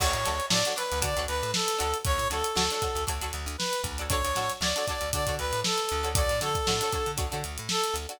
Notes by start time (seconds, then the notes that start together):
0.00 D2 D4 F#4 A4 C#5, kick, crash
0.13 A2, closed hi-hat
0.25 D2 D4 F#4 A4 C#5, snare, closed hi-hat
0.40 closed hi-hat
0.50 A2 D4 F#4 A4 C#5 D5, snare
0.65 D4 F#4 A4 C#5, snare, closed hi-hat
0.76 D4 F#4 A4 B4 C#5, closed hi-hat
0.92 D2, closed hi-hat
1.02 D3 D4 F#4 A4 C#5 D5, kick, closed hi-hat
1.16 D2 D4 F#4 A4 C#5, closed hi-hat
1.27 D2 B4, closed hi-hat
1.43 A2, closed hi-hat
1.54 A4, snare
1.68 closed hi-hat
1.78 D2 D4 F#4 A4 C#5, closed hi-hat
1.94 closed hi-hat
2.05 D2 C#5, kick, closed hi-hat
2.18 A2, closed hi-hat
2.30 D2 D4 F#4 A4 C#5, snare, closed hi-hat
2.44 closed hi-hat
2.55 D2 D4 F#4 A4 C#5, snare
2.71 D4 F#4 A4 C#5, closed hi-hat
2.82 D4 F#4 A4 C#5, kick, closed hi-hat
2.95 D2, closed hi-hat
3.07 D2 D4 F#4 A4 C#5, kick, closed hi-hat
3.21 D2 D4 F#4 A4 C#5, closed hi-hat
3.33 D2, snare, closed hi-hat
3.46 D2, closed hi-hat
3.58 B4, snare
3.73 closed hi-hat
3.84 D2, kick, closed hi-hat
3.98 D4 F#4 A4 C#5, closed hi-hat
4.09 D4 F#4 A4 C#5, kick, closed hi-hat
4.13 C#5
4.25 D2, closed hi-hat
4.35 A2 D4 F#4 A4 C#5, snare, closed hi-hat
4.50 snare, closed hi-hat
4.61 D2 D4 F#4 A4 C#5 D5, snare
4.76 D4 F#4 A4 C#5, closed hi-hat
4.87 D4 F#4 A4 D5, kick, closed hi-hat
4.91 C#5
5.01 D2, closed hi-hat
5.13 D3 D4 F#4 A4 C#5 D5, kick, closed hi-hat
5.27 D3 D4 F#4 A4 C#5, kick, closed hi-hat
5.39 D2 B4, closed hi-hat
5.53 A2, closed hi-hat
5.64 A4, snare
5.78 closed hi-hat
5.89 D2, closed hi-hat
6.03 D4 F#4 A4 C#5, closed hi-hat
6.15 D4 F#4 A4 C#5 D5, kick, closed hi-hat
6.29 A2, snare, closed hi-hat
6.41 D3 D4 F#4 A4 C#5, snare, closed hi-hat
6.55 kick, closed hi-hat
6.67 A2 D4 F#4 A4 C#5, snare
6.81 D4 F#4 A4 C#5, closed hi-hat
6.93 D4 F#4 A4 C#5, kick, closed hi-hat
7.06 D3, closed hi-hat
7.17 D2 D4 F#4 A4 C#5, kick, closed hi-hat
7.32 D3 D4 F#4 A4 C#5, closed hi-hat
7.44 D2, closed hi-hat
7.58 A2, closed hi-hat
7.69 A4, snare
7.84 closed hi-hat
7.94 D2, closed hi-hat
8.09 D4 F#4 A4 C#5, closed hi-hat